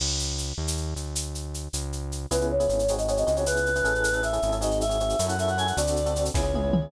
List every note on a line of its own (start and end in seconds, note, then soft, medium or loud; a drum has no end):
0.00 0.53 C#2 medium
0.00 crash medium
0.19 shaker medium
0.38 shaker medium
0.58 0.94 D#2 medium
0.67 shaker medium
0.77 shaker medium
0.96 1.68 D2 medium
0.96 shaker medium
1.15 shaker medium
1.35 shaker medium
1.54 shaker medium
1.73 2.26 C#2 medium
1.73 shaker medium
1.93 shaker medium
2.12 shaker medium
2.31 2.68 C#2 medium
2.31 2.54 B3 medium
2.31 2.54 C#4 medium
2.31 2.54 E4 medium
2.31 2.54 G#4 medium
2.31 2.46 B4 medium
2.31 shaker medium
2.41 shaker soft
2.50 2.92 C#5 medium
2.60 2.67 B3 medium
2.60 2.67 C#4 medium
2.60 2.67 E4 medium
2.60 2.67 G#4 medium
2.60 shaker medium
2.68 3.24 G#1 loud
2.68 2.83 B3 medium
2.68 2.83 C#4 medium
2.68 2.83 E4 medium
2.68 2.83 G#4 medium
2.68 shaker medium
2.79 shaker medium
2.88 2.97 C4 medium
2.88 2.97 D#4 medium
2.88 2.97 F#4 medium
2.88 2.97 G#4 medium
2.88 shaker medium
2.98 3.06 C4 medium
2.98 3.06 D#4 medium
2.98 3.06 F#4 medium
2.98 3.06 G#4 medium
2.98 3.07 D#5 medium
2.98 shaker medium
3.08 3.16 C4 medium
3.08 3.16 D#4 medium
3.08 3.16 F#4 medium
3.08 3.16 G#4 medium
3.08 3.17 C#5 medium
3.08 shaker medium
3.16 3.24 C4 medium
3.16 3.24 D#4 medium
3.16 3.24 F#4 medium
3.16 3.24 G#4 medium
3.16 3.26 D#5 medium
3.16 shaker medium
3.26 3.82 C#2 loud
3.26 3.34 C4 medium
3.26 3.34 D#4 medium
3.26 3.34 F#4 medium
3.26 3.34 G#4 medium
3.26 3.36 D#5 medium
3.26 shaker medium
3.36 3.44 C4 medium
3.36 3.44 D#4 medium
3.36 3.44 F#4 medium
3.36 3.44 G#4 medium
3.36 3.46 C#5 medium
3.36 shaker medium
3.46 3.69 B3 medium
3.46 3.69 C#4 medium
3.46 3.69 E4 medium
3.46 3.69 G#4 medium
3.46 4.22 B4 medium
3.46 shaker medium
3.56 shaker medium
3.66 shaker medium
3.75 3.83 B3 medium
3.75 3.83 C#4 medium
3.75 3.83 E4 medium
3.75 3.83 G#4 medium
3.75 shaker medium
3.84 4.39 A1 medium
3.84 4.11 C#4 medium
3.84 4.11 E4 medium
3.84 4.11 G#4 medium
3.84 4.11 A4 medium
3.84 shaker medium
3.95 shaker medium
4.04 shaker medium
4.13 4.20 C#4 medium
4.13 4.20 E4 medium
4.13 4.20 G#4 medium
4.13 4.20 A4 medium
4.13 shaker medium
4.23 4.30 C#4 medium
4.23 4.30 E4 medium
4.23 4.30 G#4 medium
4.23 4.30 A4 medium
4.23 4.55 E5 medium
4.23 shaker medium
4.33 4.40 C#4 medium
4.33 4.40 E4 medium
4.33 4.40 G#4 medium
4.33 4.40 A4 medium
4.33 shaker medium
4.42 5.15 G#1 loud
4.42 4.51 C#4 medium
4.42 4.51 E4 medium
4.42 4.51 G#4 medium
4.42 4.51 A4 medium
4.42 shaker medium
4.52 4.60 C#4 medium
4.52 4.60 E4 medium
4.52 4.60 G#4 medium
4.52 4.60 A4 medium
4.52 shaker medium
4.61 4.84 C4 medium
4.61 4.84 D#4 medium
4.61 4.84 F#4 medium
4.61 4.84 G#4 medium
4.61 4.78 D#5 medium
4.61 shaker medium
4.71 shaker medium
4.81 5.25 E5 medium
4.81 shaker medium
4.89 4.97 C4 medium
4.89 4.97 D#4 medium
4.89 4.97 F#4 medium
4.89 4.97 G#4 medium
4.89 shaker medium
5.00 5.16 C4 medium
5.00 5.16 D#4 medium
5.00 5.16 F#4 medium
5.00 5.16 G#4 medium
5.00 shaker medium
5.09 shaker medium
5.19 5.72 F#2 loud
5.19 5.27 C#4 medium
5.19 5.27 E4 medium
5.19 5.27 F#4 medium
5.19 5.27 A4 medium
5.19 shaker medium
5.28 5.36 C#4 medium
5.28 5.36 E4 medium
5.28 5.36 F#4 medium
5.28 5.36 A4 medium
5.28 5.37 F#5 medium
5.28 shaker medium
5.39 5.46 C#4 medium
5.39 5.46 E4 medium
5.39 5.46 F#4 medium
5.39 5.46 A4 medium
5.39 5.48 E5 medium
5.39 shaker medium
5.47 5.55 C#4 medium
5.47 5.55 E4 medium
5.47 5.55 F#4 medium
5.47 5.55 A4 medium
5.47 5.58 F#5 medium
5.47 shaker medium
5.57 5.65 C#4 medium
5.57 5.65 E4 medium
5.57 5.65 F#4 medium
5.57 5.65 A4 medium
5.57 5.67 G#5 medium
5.57 shaker medium
5.66 5.74 C#4 medium
5.66 5.74 E4 medium
5.66 5.74 F#4 medium
5.66 5.74 A4 medium
5.66 5.76 F#5 medium
5.66 shaker medium
5.77 6.30 D2 loud
5.77 6.01 C4 medium
5.77 6.01 D4 medium
5.77 6.01 F#4 medium
5.77 6.01 A4 medium
5.77 6.23 D5 medium
5.77 shaker medium
5.87 shaker medium
5.96 shaker medium
6.06 6.13 C4 medium
6.06 6.13 D4 medium
6.06 6.13 F#4 medium
6.06 6.13 A4 medium
6.06 shaker medium
6.16 6.32 C4 medium
6.16 6.32 D4 medium
6.16 6.32 F#4 medium
6.16 6.32 A4 medium
6.16 shaker medium
6.25 shaker medium
6.34 6.88 C#2 loud
6.34 6.42 B3 medium
6.34 6.42 C#4 medium
6.34 6.42 E4 medium
6.34 6.42 G#4 medium
6.34 6.86 C#5 medium
6.34 kick medium
6.34 snare medium
6.43 6.51 B3 medium
6.43 6.51 C#4 medium
6.43 6.51 E4 medium
6.43 6.51 G#4 medium
6.54 6.63 B3 medium
6.54 6.63 C#4 medium
6.54 6.63 E4 medium
6.54 6.63 G#4 medium
6.54 high tom medium
6.63 6.71 B3 medium
6.63 6.71 C#4 medium
6.63 6.71 E4 medium
6.63 6.71 G#4 medium
6.73 6.81 B3 medium
6.73 6.81 C#4 medium
6.73 6.81 E4 medium
6.73 6.81 G#4 medium
6.73 mid tom loud
6.82 6.89 B3 medium
6.82 6.89 C#4 medium
6.82 6.89 E4 medium
6.82 6.89 G#4 medium